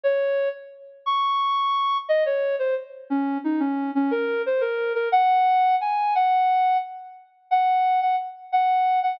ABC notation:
X:1
M:6/8
L:1/8
Q:3/8=118
K:Db
V:1 name="Ocarina"
d3 z3 | d'6 | e d2 c z2 | D2 E D2 D |
B2 c B2 B | g4 a2 | g4 z2 | [K:Bbm] z2 g3 g |
z2 g3 g |]